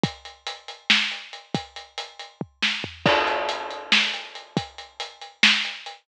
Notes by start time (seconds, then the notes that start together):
0.04 kick, closed hi-hat
0.25 closed hi-hat
0.47 closed hi-hat
0.68 closed hi-hat
0.90 snare
1.11 closed hi-hat
1.33 closed hi-hat
1.54 kick, closed hi-hat
1.76 closed hi-hat
1.98 closed hi-hat
2.19 closed hi-hat
2.41 kick
2.62 snare
2.84 floor tom
3.06 kick, crash
3.27 closed hi-hat
3.49 closed hi-hat
3.71 closed hi-hat
3.92 snare
4.13 closed hi-hat
4.35 closed hi-hat
4.57 kick, closed hi-hat
4.78 closed hi-hat
5.00 closed hi-hat
5.21 closed hi-hat
5.43 snare
5.65 closed hi-hat
5.86 closed hi-hat